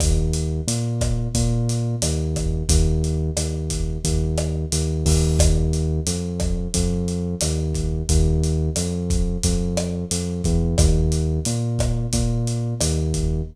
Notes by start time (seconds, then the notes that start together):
0.00 D#2, kick, cross-stick, closed hi-hat
0.33 closed hi-hat
0.67 A#2, closed hi-hat
1.01 kick, cross-stick, closed hi-hat
1.35 A#2, kick, closed hi-hat
1.69 closed hi-hat
2.02 D#2, cross-stick, closed hi-hat
2.36 kick, cross-stick, closed hi-hat
2.69 D#2, kick, closed hi-hat
3.04 closed hi-hat
3.37 D#2, cross-stick, closed hi-hat
3.70 kick, closed hi-hat
4.04 D#2, kick, closed hi-hat
4.38 cross-stick, closed hi-hat
4.72 D#2, closed hi-hat
5.06 D#2, kick, open hi-hat
5.39 kick, cross-stick, closed hi-hat
5.73 closed hi-hat
6.07 F2, closed hi-hat
6.40 kick, cross-stick, closed hi-hat
6.74 F2, kick, closed hi-hat
7.08 closed hi-hat
7.41 D#2, cross-stick, closed hi-hat
7.74 kick, closed hi-hat
8.09 D#2, kick, closed hi-hat
8.44 closed hi-hat
8.76 F2, cross-stick, closed hi-hat
9.10 kick, closed hi-hat
9.43 F2, kick, closed hi-hat
9.77 cross-stick, closed hi-hat
10.11 F2, closed hi-hat
10.44 E2, kick, closed hi-hat
10.78 D#2, kick, cross-stick, closed hi-hat
11.12 closed hi-hat
11.45 A#2, closed hi-hat
11.79 kick, cross-stick, closed hi-hat
12.13 A#2, kick, closed hi-hat
12.47 closed hi-hat
12.81 D#2, cross-stick, closed hi-hat
13.14 kick, closed hi-hat